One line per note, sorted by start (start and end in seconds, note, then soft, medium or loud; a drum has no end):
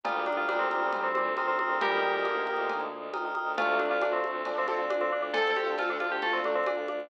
0.03 0.22 D2 loud
0.03 0.42 A#2 medium
0.03 0.42 G3 loud
0.03 1.80 D#4 medium
0.03 1.80 F4 medium
0.03 0.25 F4 medium
0.03 1.80 G4 medium
0.03 1.80 A#4 medium
0.03 0.14 G5 loud
0.03 0.14 A#5 loud
0.03 0.14 D#6 loud
0.03 0.14 F6 loud
0.03 cowbell loud
0.03 low conga loud
0.16 0.25 G5 medium
0.16 0.25 A#5 medium
0.16 0.25 D#6 medium
0.16 0.25 F6 medium
0.26 0.45 D2 medium
0.26 0.37 D4 medium
0.26 0.36 G5 medium
0.26 0.36 A#5 medium
0.26 0.36 D#6 medium
0.26 0.36 F6 medium
0.26 high conga medium
0.37 0.48 F4 medium
0.37 0.46 G5 medium
0.37 0.46 A#5 medium
0.37 0.46 D#6 medium
0.37 0.46 F6 medium
0.48 0.68 D2 loud
0.48 0.92 A#2 loud
0.48 0.92 G3 loud
0.48 0.59 D4 medium
0.48 0.67 G5 medium
0.48 0.67 A#5 loud
0.48 0.67 D#6 medium
0.48 0.67 F6 loud
0.48 cowbell medium
0.48 high conga loud
0.59 0.99 C4 medium
0.70 0.89 D2 medium
0.70 1.06 G5 loud
0.70 1.06 A#5 loud
0.70 1.06 D#6 medium
0.70 1.06 F6 loud
0.70 high conga medium
0.91 1.10 D2 medium
0.91 1.12 A#2 medium
0.91 1.12 G3 loud
0.91 cowbell medium
0.91 low conga loud
1.03 1.14 C4 medium
1.15 1.34 D2 loud
1.15 1.26 A#2 medium
1.15 1.26 G3 loud
1.15 1.33 C4 loud
1.15 high conga medium
1.36 1.55 D2 loud
1.36 1.47 C4 medium
1.36 1.46 G5 medium
1.36 1.46 A#5 medium
1.36 1.46 D#6 loud
1.36 1.46 F6 loud
1.36 cowbell medium
1.36 high conga medium
1.48 1.58 C4 loud
1.48 1.57 G5 medium
1.48 1.57 A#5 loud
1.48 1.57 D#6 medium
1.48 1.57 F6 loud
1.59 1.78 D2 medium
1.59 1.69 C4 medium
1.59 1.85 G5 medium
1.59 1.85 A#5 medium
1.59 1.85 D#6 medium
1.59 1.85 F6 medium
1.59 high conga medium
1.70 1.80 C4 medium
1.81 2.00 D2 loud
1.81 2.24 A#2 loud
1.81 2.24 G3 loud
1.81 3.56 D#4 medium
1.81 3.56 F4 medium
1.81 2.72 G4 medium
1.81 3.56 A#4 medium
1.81 2.72 A#4 loud
1.81 3.56 D#5 medium
1.81 cowbell loud
1.81 low conga loud
1.91 2.00 G5 loud
1.91 2.00 A#5 medium
1.91 2.00 D#6 medium
1.91 2.00 F6 medium
2.02 2.21 D2 medium
2.02 2.12 G5 medium
2.02 2.12 A#5 medium
2.02 2.12 D#6 loud
2.02 2.12 F6 medium
2.14 2.22 G5 loud
2.14 2.22 A#5 medium
2.14 2.22 D#6 medium
2.14 2.22 F6 medium
2.25 2.44 D2 medium
2.25 3.05 D3 medium
2.25 3.05 A#3 loud
2.25 2.42 G5 medium
2.25 2.42 A#5 medium
2.25 2.42 D#6 medium
2.25 2.42 F6 medium
2.25 cowbell medium
2.25 high conga medium
2.46 2.66 D2 loud
2.46 2.81 G5 medium
2.46 2.81 A#5 loud
2.46 2.81 D#6 medium
2.46 2.81 F6 medium
2.46 high conga medium
2.68 2.86 D2 loud
2.68 cowbell medium
2.68 low conga loud
2.92 3.10 D2 medium
3.13 3.31 D2 medium
3.13 3.23 G5 medium
3.13 3.23 A#5 loud
3.13 3.23 D#6 medium
3.13 3.23 F6 medium
3.13 cowbell medium
3.13 high conga loud
3.25 3.34 G5 medium
3.25 3.34 A#5 medium
3.25 3.34 D#6 medium
3.25 3.34 F6 medium
3.35 3.56 D2 medium
3.35 3.52 G5 loud
3.35 3.52 A#5 medium
3.35 3.52 D#6 medium
3.35 3.52 F6 medium
3.35 high conga medium
3.57 3.76 D2 loud
3.57 3.96 C3 loud
3.57 3.96 A3 loud
3.57 5.32 D4 medium
3.57 5.32 F4 medium
3.57 3.78 F4 loud
3.57 5.32 A4 medium
3.57 3.85 A4 loud
3.57 3.85 D5 loud
3.57 3.85 F5 loud
3.57 cowbell loud
3.57 low conga loud
3.79 3.98 D2 loud
3.79 3.90 D4 medium
3.79 high conga medium
3.90 4.01 F4 medium
3.90 4.25 A4 loud
3.90 4.25 D5 loud
3.90 4.25 F5 loud
4.00 4.19 D2 loud
4.00 4.41 C3 medium
4.00 4.41 A3 medium
4.00 4.13 D4 medium
4.00 cowbell medium
4.00 high conga loud
4.13 4.49 C4 medium
4.23 4.42 D2 loud
4.23 high conga medium
4.45 4.66 D2 loud
4.45 4.65 F3 medium
4.45 4.65 D4 loud
4.45 cowbell medium
4.45 low conga loud
4.58 4.67 C4 loud
4.58 4.76 A4 loud
4.58 4.76 D5 loud
4.58 4.76 F5 medium
4.67 4.87 D2 loud
4.67 4.88 C4 medium
4.67 4.79 C4 medium
4.67 4.79 A4 loud
4.67 high conga medium
4.79 4.96 A4 medium
4.79 4.96 D5 loud
4.79 4.96 F5 medium
4.90 5.09 D2 medium
4.90 5.01 D4 medium
4.90 cowbell medium
4.90 high conga loud
5.01 5.12 C4 medium
5.01 5.10 A4 loud
5.01 5.10 D5 loud
5.01 5.10 F5 medium
5.11 5.30 D2 medium
5.11 5.22 D4 medium
5.11 5.46 A4 loud
5.11 5.46 D5 medium
5.11 5.46 F5 medium
5.22 5.33 D4 medium
5.34 5.55 D2 medium
5.34 7.09 A3 medium
5.34 5.73 C4 loud
5.34 7.09 D4 medium
5.34 5.53 A4 loud
5.34 7.09 A4 medium
5.34 5.73 A4 loud
5.34 cowbell loud
5.34 low conga loud
5.56 5.74 D2 loud
5.56 5.76 G4 medium
5.56 high conga medium
5.67 6.02 A4 loud
5.67 6.02 D5 medium
5.67 6.02 F5 medium
5.78 5.98 D2 loud
5.78 6.19 C4 medium
5.78 5.90 F4 medium
5.78 6.19 A4 loud
5.78 cowbell medium
5.78 high conga loud
5.90 6.00 D4 medium
6.00 6.19 D2 loud
6.00 6.11 F4 medium
6.00 high conga medium
6.12 6.22 G4 medium
6.22 6.40 D2 loud
6.22 6.40 A3 medium
6.22 6.40 F4 loud
6.22 6.33 A4 loud
6.22 cowbell medium
6.22 low conga loud
6.33 6.44 C4 medium
6.33 6.51 A4 loud
6.33 6.51 D5 loud
6.33 6.51 F5 medium
6.44 6.62 D2 medium
6.44 6.55 C3 medium
6.44 6.55 A3 loud
6.44 6.56 D4 medium
6.44 high conga medium
6.55 6.66 C4 medium
6.55 6.73 A4 loud
6.55 6.73 D5 loud
6.55 6.73 F5 medium
6.66 6.86 D2 medium
6.66 6.86 D4 medium
6.66 cowbell loud
6.66 high conga loud
6.78 6.87 A4 loud
6.78 6.87 D5 loud
6.78 6.87 F5 medium
6.88 7.07 D2 medium
6.88 7.08 D4 medium
6.88 7.07 A4 loud
6.88 7.07 D5 medium
6.88 7.07 F5 medium
6.88 high conga medium